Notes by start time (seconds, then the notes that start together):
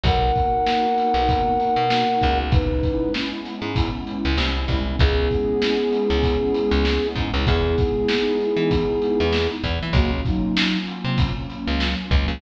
0.03 B1 A#3 B3 D#4 F#4 A#4 F#5, kick, closed hi-hat
0.35 kick, closed hi-hat
0.66 snare
0.98 closed hi-hat
1.14 B1
1.29 kick, closed hi-hat
1.60 closed hi-hat
1.76 B2
1.90 snare
2.21 C#2, kick, closed hi-hat
2.52 G#3 B3 C#4 D#4 E4 B4, kick, closed hi-hat
2.83 kick, closed hi-hat
3.14 snare
3.45 snare, closed hi-hat
3.62 G#2
3.76 kick, closed hi-hat
4.07 closed hi-hat
4.25 C#2
4.38 C2, snare
4.68 C2, kick, closed hi-hat
4.99 C#2 G#3 B3 C#4 E4 G#4, kick, closed hi-hat
5.31 kick, closed hi-hat
5.62 snare
5.93 closed hi-hat
6.10 C#2
6.23 kick, closed hi-hat
6.54 closed hi-hat
6.71 C#2
6.85 snare
7.16 G#2, kick, closed hi-hat
7.34 C#2
7.46 E2 G#3 B3 D#4 E4 G#4, kick, closed hi-hat
7.78 kick, closed hi-hat
8.09 snare
8.40 closed hi-hat
8.57 E3
8.71 kick, closed hi-hat
9.02 closed hi-hat
9.20 E2
9.33 snare
9.64 E2 F#3 A#3 C#4 F4, kick, closed hi-hat
9.83 E3
9.93 C#2 A#3 F#4, kick, closed hi-hat
10.25 F#3 D#4, kick, closed hi-hat
10.57 snare
10.87 closed hi-hat
11.05 C3
11.18 kick, closed hi-hat
11.50 closed hi-hat
11.68 C#2
11.80 snare
12.11 C#2, kick, closed hi-hat
12.28 C#2